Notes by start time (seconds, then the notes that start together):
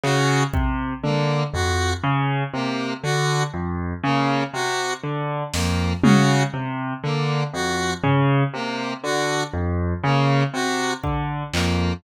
0.04 C#3 F#4, clap
0.54 C3, kick
1.04 D3 A#3, high tom
1.54 F2 F#4, floor tom
2.04 C#3
2.54 C3 A#3
3.03 D3 F#4
3.54 F2
4.04 C#3 A#3
4.54 C3 F#4
5.04 D3
5.54 F2 A#3, snare
6.03 C#3 F#4, high tom
6.54 C3
7.04 D3 A#3
7.54 F2 F#4
8.04 C#3, floor tom
8.54 C3 A#3
9.04 D3 F#4
9.54 F2
10.04 C#3 A#3
10.54 C3 F#4
11.04 D3, kick
11.54 F2 A#3, clap